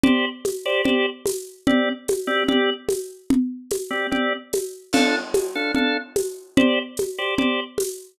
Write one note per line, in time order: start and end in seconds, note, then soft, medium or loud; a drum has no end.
0.04 0.25 G4 medium
0.04 0.25 C5 medium
0.04 0.25 D5 medium
0.04 low conga medium
0.45 tambourine medium
0.45 high conga medium
0.66 0.82 G4 medium
0.66 0.82 C5 medium
0.66 0.82 D5 medium
0.84 1.06 G4 medium
0.84 1.06 C5 medium
0.84 1.06 D5 medium
0.84 low conga medium
1.26 tambourine medium
1.26 high conga medium
1.67 1.89 C4 medium
1.67 1.89 G4 medium
1.67 1.89 D5 medium
1.67 low conga medium
2.08 tambourine medium
2.08 high conga medium
2.27 2.44 C4 medium
2.27 2.44 G4 medium
2.27 2.44 D5 medium
2.48 2.70 C4 medium
2.48 2.70 G4 medium
2.48 2.70 D5 medium
2.48 low conga medium
2.89 tambourine medium
2.89 high conga medium
3.30 low conga medium
3.71 tambourine medium
3.71 high conga medium
3.90 4.07 C4 medium
3.90 4.07 G4 medium
3.90 4.07 D5 medium
4.11 4.33 C4 medium
4.11 4.33 G4 medium
4.11 4.33 D5 medium
4.11 low conga medium
4.53 tambourine medium
4.53 high conga medium
4.93 5.15 D4 medium
4.93 5.15 A4 medium
4.93 5.15 F5 medium
4.93 crash medium
4.93 low conga medium
5.34 tambourine medium
5.34 high conga medium
5.55 5.72 D4 medium
5.55 5.72 A4 medium
5.55 5.72 F5 medium
5.75 5.97 D4 medium
5.75 5.97 A4 medium
5.75 5.97 F5 medium
5.75 low conga medium
6.16 tambourine medium
6.16 high conga medium
6.57 6.79 G4 medium
6.57 6.79 C5 medium
6.57 6.79 D5 medium
6.57 low conga medium
6.97 tambourine medium
6.97 high conga medium
7.18 7.35 G4 medium
7.18 7.35 C5 medium
7.18 7.35 D5 medium
7.38 7.60 G4 medium
7.38 7.60 C5 medium
7.38 7.60 D5 medium
7.38 low conga medium
7.78 tambourine medium
7.78 high conga medium